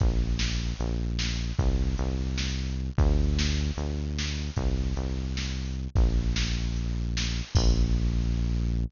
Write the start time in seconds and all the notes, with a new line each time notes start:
0.00 A#1, kick, closed hi-hat
0.39 snare
0.79 A#1, closed hi-hat
1.19 snare
1.59 C2, kick, closed hi-hat
1.98 C2, closed hi-hat
2.38 snare
2.67 closed hi-hat
2.98 D2, kick, closed hi-hat
3.39 snare
3.77 D2, closed hi-hat
4.18 snare
4.56 C2, kick, closed hi-hat
4.96 C2, closed hi-hat
5.37 snare
5.65 open hi-hat
5.95 A#1, kick, closed hi-hat
6.36 snare
6.76 closed hi-hat
7.17 snare
7.55 A#1, kick, crash